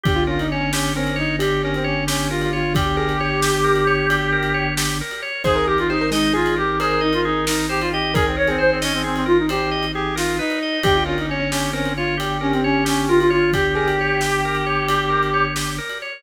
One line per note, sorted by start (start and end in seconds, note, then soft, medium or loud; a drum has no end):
0.04 5.02 G1 loud
0.04 0.24 G4 loud
0.04 0.17 G4 loud
0.04 kick loud
0.04 ride medium
0.16 0.26 F4 loud
0.27 0.38 C#4 loud
0.27 0.39 F4 medium
0.27 0.47 A#4 medium
0.39 0.50 D#4 medium
0.39 ride medium
0.50 0.60 C#4 loud
0.50 0.69 C#4 medium
0.50 0.72 C#5 medium
0.61 0.72 C#4 loud
0.73 0.92 C#4 loud
0.73 0.92 C#4 medium
0.73 0.94 G4 loud
0.73 snare loud
0.96 1.14 C4 loud
0.96 1.15 C#4 medium
0.96 1.17 A#4 medium
1.06 ride medium
1.16 1.36 D#4 loud
1.16 1.36 C#5 loud
1.39 2.62 G4 loud
1.39 1.61 G4 medium
1.39 1.62 G4 medium
1.39 ride medium
1.63 1.73 C#4 medium
1.63 1.85 A#4 medium
1.74 1.85 C4 medium
1.74 ride medium
1.84 2.05 C#4 medium
1.84 2.04 C#5 loud
2.07 2.30 C#4 medium
2.07 2.28 G4 medium
2.07 snare loud
2.30 2.41 F4 loud
2.30 2.51 A#4 medium
2.41 2.52 F4 loud
2.41 ride medium
2.53 2.73 F4 loud
2.53 2.73 C#5 medium
2.74 2.85 G4 loud
2.74 4.66 G4 loud
2.74 2.96 G4 loud
2.74 kick loud
2.74 ride loud
2.97 3.08 G#4 loud
2.97 3.17 A#4 medium
3.08 3.19 G4 medium
3.08 ride medium
3.20 3.77 G4 medium
3.20 3.41 C#5 loud
3.42 3.64 G4 medium
3.42 snare loud
3.64 3.85 A#4 medium
3.76 ride medium
3.87 4.07 C#5 medium
4.10 4.30 G4 medium
4.10 ride medium
4.32 4.53 A#4 loud
4.43 ride medium
4.54 4.74 C#5 medium
4.77 4.98 G4 medium
4.77 snare loud
5.01 5.21 A#4 medium
5.11 ride medium
5.22 5.43 C#5 medium
5.44 10.40 G#1 loud
5.44 5.65 G#4 loud
5.44 5.66 G#4 loud
5.44 5.55 C5 loud
5.44 kick medium
5.44 crash medium
5.55 5.66 A#4 loud
5.67 5.78 G4 loud
5.67 5.88 A#4 medium
5.78 5.89 F4 loud
5.78 ride medium
5.90 6.09 D#4 medium
5.90 6.00 G4 loud
5.90 6.10 C5 medium
6.01 6.12 A#4 loud
6.11 6.31 G#3 loud
6.11 6.34 D#4 loud
6.11 6.32 D#5 loud
6.11 snare medium
6.34 6.56 F4 loud
6.34 6.54 G#4 loud
6.34 6.55 G#4 medium
6.46 ride medium
6.56 6.78 G4 loud
6.56 6.77 A#4 medium
6.80 7.01 G#4 loud
6.80 7.92 A#4 loud
6.80 7.01 C5 medium
6.80 ride medium
7.01 7.12 D#4 loud
7.01 7.21 D#5 medium
7.13 7.24 F4 loud
7.13 ride medium
7.25 7.45 D#4 loud
7.25 7.45 G#4 loud
7.47 7.66 D#4 medium
7.47 7.67 A#4 medium
7.47 snare loud
7.69 7.80 G4 loud
7.69 7.89 C5 medium
7.81 7.91 F4 loud
7.81 ride medium
7.92 8.12 G4 medium
7.92 8.14 D#5 medium
8.14 8.25 G#4 loud
8.14 8.36 G#4 medium
8.14 8.25 A#4 loud
8.14 kick loud
8.14 ride medium
8.26 8.36 C4 medium
8.37 8.57 A#4 medium
8.37 8.48 C#5 loud
8.47 8.59 C4 loud
8.47 9.15 G#4 loud
8.47 ride medium
8.58 8.79 C5 medium
8.58 8.70 C5 medium
8.71 8.82 C4 medium
8.82 8.93 C#4 loud
8.82 9.02 D#5 medium
8.82 snare medium
8.93 9.04 C4 medium
9.04 9.15 C4 loud
9.04 9.24 G#4 medium
9.15 9.26 C4 loud
9.15 ride medium
9.26 9.37 F4 loud
9.26 9.46 A#4 medium
9.38 9.49 D#4 medium
9.49 9.85 G4 loud
9.49 9.70 C5 medium
9.49 ride medium
9.71 9.92 D#5 medium
9.83 ride medium
9.94 10.15 G4 loud
9.94 10.15 G#4 loud
10.16 10.37 F4 loud
10.16 10.36 A#4 medium
10.16 snare medium
10.39 10.79 D#4 loud
10.39 10.59 B4 medium
10.50 ride medium
10.62 10.83 D#5 medium
10.83 15.80 G1 loud
10.83 11.04 G4 loud
10.83 10.95 G4 loud
10.83 11.03 G5 loud
10.83 kick medium
10.83 ride loud
10.96 11.06 F4 loud
11.06 11.17 C#4 loud
11.06 11.17 F4 medium
11.06 11.26 A#4 medium
11.18 11.28 D#4 medium
11.18 ride medium
11.29 11.39 C#4 loud
11.29 11.48 C#4 medium
11.29 11.51 C#5 medium
11.40 11.50 C#4 loud
11.51 11.70 C#4 loud
11.51 11.71 C#4 medium
11.51 11.72 G4 medium
11.51 snare medium
11.73 11.92 C4 loud
11.73 11.93 C#4 medium
11.73 11.93 A#4 loud
11.85 ride medium
11.96 12.15 F4 loud
11.96 12.18 C#5 loud
12.17 12.38 G4 medium
12.17 12.39 G4 medium
12.17 13.43 G4 loud
12.17 ride medium
12.41 12.52 C#4 loud
12.41 12.61 A#4 medium
12.52 12.63 C4 medium
12.52 ride medium
12.64 12.84 C#4 medium
12.64 12.84 C#5 loud
12.85 13.08 C#4 loud
12.85 13.05 G4 medium
12.85 snare medium
13.08 13.19 F4 loud
13.08 13.29 A#4 medium
13.20 13.31 F4 loud
13.20 ride medium
13.30 13.52 F4 loud
13.30 13.50 C#5 medium
13.53 13.74 G4 medium
13.53 15.45 G4 loud
13.53 13.65 G4 loud
13.53 kick medium
13.53 ride medium
13.75 13.86 G#4 loud
13.75 13.96 A#4 medium
13.87 13.98 G4 loud
13.87 ride medium
13.99 14.55 G4 loud
13.99 14.21 C#5 medium
14.21 14.43 G4 medium
14.21 snare medium
14.45 14.65 A#4 medium
14.55 ride medium
14.66 14.87 C#5 medium
14.88 15.10 G4 medium
14.88 ride medium
15.10 15.30 A#4 medium
15.23 ride medium
15.34 15.54 C#5 medium
15.56 15.76 G4 medium
15.56 snare medium
15.78 15.99 A#4 medium
15.89 ride medium
16.02 16.22 C#5 medium